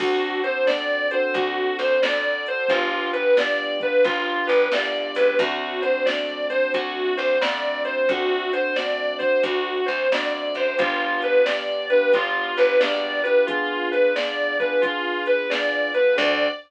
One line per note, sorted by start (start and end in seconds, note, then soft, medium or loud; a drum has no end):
0.00 1.21 D2 medium
0.00 0.40 C4 medium
0.00 0.40 D4 medium
0.00 0.40 F#4 medium
0.00 0.40 A4 loud
0.00 kick loud
0.00 crash loud
0.44 0.66 C4 medium
0.44 0.66 D4 medium
0.44 0.66 F#4 medium
0.44 0.66 A4 medium
0.44 0.65 C5 medium
0.44 closed hi-hat medium
0.67 1.07 C4 medium
0.67 1.07 D4 medium
0.67 1.07 F#4 medium
0.67 1.07 A4 medium
0.67 1.07 D5 medium
0.67 snare loud
1.11 1.97 C4 medium
1.11 1.97 D4 medium
1.11 1.97 F#4 medium
1.11 1.97 A4 medium
1.11 1.32 C5 medium
1.11 closed hi-hat loud
1.34 1.71 D2 medium
1.34 1.75 F#4 medium
1.34 kick loud
1.34 closed hi-hat loud
1.79 1.99 D2 medium
1.79 2.01 C5 medium
1.79 closed hi-hat medium
2.02 2.63 F2 medium
2.02 2.67 C4 medium
2.02 2.67 D4 medium
2.02 2.67 F#4 medium
2.02 2.67 A4 medium
2.02 2.42 D5 medium
2.02 snare loud
2.46 2.70 C5 medium
2.46 closed hi-hat loud
2.68 3.90 G1 medium
2.68 3.10 B3 medium
2.68 3.10 D4 loud
2.68 3.10 F4 medium
2.68 3.10 G4 medium
2.68 kick loud
2.68 closed hi-hat loud
3.13 3.36 B3 medium
3.13 3.36 D4 medium
3.13 3.36 F4 medium
3.13 3.36 G4 medium
3.13 3.35 B4 medium
3.13 closed hi-hat loud
3.37 3.78 B3 medium
3.37 3.78 D4 medium
3.37 3.78 F4 medium
3.37 3.78 G4 medium
3.37 3.78 D5 medium
3.37 snare loud
3.80 4.65 B3 medium
3.80 4.65 D4 medium
3.80 4.65 F4 medium
3.80 4.65 G4 medium
3.80 4.04 B4 medium
3.80 kick loud
3.80 closed hi-hat medium
4.04 4.42 G1 medium
4.04 4.45 F4 medium
4.04 kick loud
4.04 closed hi-hat loud
4.47 4.69 G1 medium
4.47 4.69 B4 medium
4.47 closed hi-hat medium
4.72 5.12 C2 medium
4.72 5.37 B3 medium
4.72 5.37 D4 medium
4.72 5.37 F4 medium
4.72 5.37 G4 medium
4.72 5.13 D5 medium
4.72 snare loud
5.15 5.37 C#2 medium
5.15 5.38 B4 medium
5.15 open hi-hat loud
5.38 6.60 D2 medium
5.38 5.79 A3 loud
5.38 5.79 C4 loud
5.38 5.79 D4 loud
5.38 5.79 F#4 loud
5.38 5.80 F#4 medium
5.38 kick loud
5.38 closed hi-hat loud
5.82 6.05 A3 medium
5.82 6.05 C4 medium
5.82 6.05 D4 medium
5.82 6.05 F#4 medium
5.82 6.03 C5 medium
5.82 closed hi-hat medium
6.06 6.46 A3 medium
6.06 6.46 C4 medium
6.06 6.46 D4 medium
6.06 6.46 F#4 medium
6.06 6.46 D5 medium
6.06 snare loud
6.50 7.35 A3 medium
6.50 7.35 C4 medium
6.50 7.35 D4 medium
6.50 7.35 F#4 medium
6.50 6.71 C5 medium
6.50 closed hi-hat loud
6.74 7.12 D2 medium
6.74 7.14 F#4 medium
6.74 kick loud
6.74 closed hi-hat loud
7.17 7.38 D2 medium
7.17 7.39 C5 medium
7.17 closed hi-hat medium
7.40 8.02 F2 medium
7.40 8.04 A3 medium
7.40 8.04 C4 medium
7.40 8.04 D4 medium
7.40 8.04 F#4 medium
7.40 7.82 D5 medium
7.40 snare loud
7.85 8.06 C5 medium
7.85 closed hi-hat medium
8.09 9.29 D2 medium
8.09 8.50 A3 loud
8.09 8.50 C4 loud
8.09 8.50 D4 loud
8.09 8.50 F#4 loud
8.09 8.51 F#4 medium
8.09 kick loud
8.09 closed hi-hat loud
8.53 8.74 A3 medium
8.53 8.74 C4 medium
8.53 8.74 D4 medium
8.53 8.74 F#4 medium
8.53 8.75 C5 medium
8.53 closed hi-hat loud
8.76 9.18 A3 medium
8.76 9.18 C4 medium
8.76 9.18 D4 medium
8.76 9.18 F#4 medium
8.76 9.16 D5 medium
8.76 snare loud
9.19 10.05 A3 medium
9.19 10.05 C4 medium
9.19 10.05 D4 medium
9.19 10.05 F#4 medium
9.19 9.41 C5 medium
9.19 kick medium
9.19 closed hi-hat medium
9.43 9.81 D2 medium
9.43 9.83 F#4 medium
9.43 kick loud
9.43 closed hi-hat loud
9.86 10.08 D2 medium
9.86 10.08 C5 medium
9.86 closed hi-hat medium
10.12 10.51 F2 medium
10.12 10.77 A3 medium
10.12 10.77 C4 medium
10.12 10.77 D4 medium
10.12 10.77 F#4 medium
10.12 10.53 D5 medium
10.12 snare loud
10.54 10.76 F#2 medium
10.54 10.78 C5 medium
10.54 closed hi-hat loud
10.78 11.99 G1 medium
10.78 11.41 B3 loud
10.78 11.41 D4 loud
10.78 11.41 F4 loud
10.78 11.19 F4 medium
10.78 11.41 G4 loud
10.78 kick loud
10.78 closed hi-hat loud
11.22 11.45 B4 medium
11.22 closed hi-hat medium
11.45 11.87 B3 medium
11.45 11.87 D4 medium
11.45 11.87 F4 medium
11.45 11.87 G4 medium
11.45 11.86 D5 medium
11.45 snare loud
11.90 12.12 B3 medium
11.90 12.12 D4 medium
11.90 12.12 F4 medium
11.90 12.12 G4 medium
11.90 12.11 B4 medium
11.90 closed hi-hat medium
12.12 12.51 G1 medium
12.12 12.76 B3 medium
12.12 12.76 D4 medium
12.12 12.76 F4 medium
12.12 12.55 F4 medium
12.12 12.76 G4 medium
12.12 kick loud
12.12 closed hi-hat loud
12.57 12.78 G1 medium
12.57 12.79 B4 medium
12.57 closed hi-hat medium
12.79 13.42 A#1 medium
12.79 13.20 B3 medium
12.79 13.20 D4 medium
12.79 13.20 F4 medium
12.79 13.20 G4 medium
12.79 13.20 D5 medium
12.79 snare loud
13.23 13.47 B3 loud
13.23 13.47 D4 medium
13.23 13.47 F4 medium
13.23 13.47 G4 medium
13.23 13.45 B4 medium
13.23 closed hi-hat medium
13.47 14.12 B3 loud
13.47 14.12 D4 medium
13.47 13.87 F4 medium
13.47 14.12 F4 loud
13.47 14.12 G#4 loud
13.47 kick loud
13.47 closed hi-hat loud
13.91 14.13 B4 medium
13.91 closed hi-hat medium
14.15 14.56 B3 medium
14.15 14.56 D4 medium
14.15 14.56 F4 medium
14.15 14.56 G#4 medium
14.15 14.56 D5 medium
14.15 snare loud
14.59 14.82 B3 medium
14.59 14.82 D4 medium
14.59 14.82 F4 medium
14.59 14.82 G#4 medium
14.59 14.81 B4 medium
14.59 kick loud
14.59 closed hi-hat medium
14.81 15.47 B3 medium
14.81 15.47 D4 medium
14.81 15.22 F4 medium
14.81 15.47 F4 medium
14.81 15.47 G#4 medium
14.81 kick loud
14.81 closed hi-hat loud
15.26 15.48 B4 medium
15.26 closed hi-hat medium
15.50 15.90 B3 medium
15.50 15.90 D4 medium
15.50 15.90 F4 medium
15.50 15.90 G#4 medium
15.50 15.90 D5 medium
15.50 snare loud
15.94 16.17 B3 medium
15.94 16.16 D4 medium
15.94 16.17 F4 medium
15.94 16.17 G#4 medium
15.94 16.16 B4 medium
15.94 closed hi-hat medium
16.16 16.49 D2 loud
16.16 16.47 C4 loud
16.16 16.47 D4 medium
16.16 16.47 F#4 loud
16.16 16.47 A4 loud
16.16 16.48 D5 loud
16.16 kick loud
16.16 crash loud